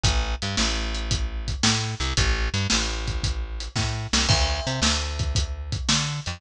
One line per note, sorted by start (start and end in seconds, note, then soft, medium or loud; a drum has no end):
0.04 0.35 A1 loud
0.04 kick medium
0.04 closed hi-hat loud
0.42 0.56 G2 medium
0.42 closed hi-hat medium
0.57 1.55 A1 loud
0.57 snare medium
0.95 closed hi-hat medium
1.11 kick medium
1.11 closed hi-hat medium
1.48 kick medium
1.48 closed hi-hat medium
1.63 1.95 A2 medium
1.63 snare loud
2.00 2.13 C2 loud
2.00 closed hi-hat medium
2.17 2.49 A1 loud
2.17 kick medium
2.17 closed hi-hat loud
2.54 2.67 G2 loud
2.54 closed hi-hat medium
2.70 3.68 A1 loud
2.70 snare medium
3.08 kick medium
3.08 closed hi-hat medium
3.24 kick medium
3.24 closed hi-hat medium
3.60 closed hi-hat medium
3.76 4.07 A2 medium
3.76 kick medium
3.76 snare medium
4.13 4.27 C2 loud
4.13 snare medium
4.29 4.60 D2 loud
4.29 kick loud
4.29 crash medium
4.67 4.80 C3 loud
4.67 closed hi-hat medium
4.82 5.78 D2 medium
4.82 snare loud
5.19 kick medium
5.19 closed hi-hat medium
5.35 kick medium
5.35 closed hi-hat medium
5.72 kick medium
5.72 closed hi-hat medium
5.89 6.20 D3 loud
5.89 snare medium
6.26 6.41 F2 medium
6.26 closed hi-hat medium